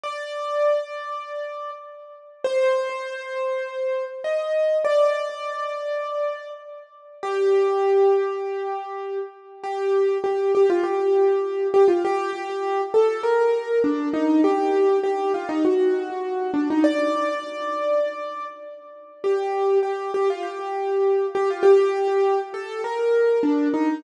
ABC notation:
X:1
M:4/4
L:1/16
Q:1/4=100
K:Gm
V:1 name="Acoustic Grand Piano"
d12 z4 | c12 e4 | d12 z4 | G14 z2 |
G4 G2 G F G6 G F | G6 A2 B4 D2 E2 | G4 G2 F E ^F6 D E | d12 z4 |
G4 G2 G F G6 G F | G6 A2 B4 D2 E2 |]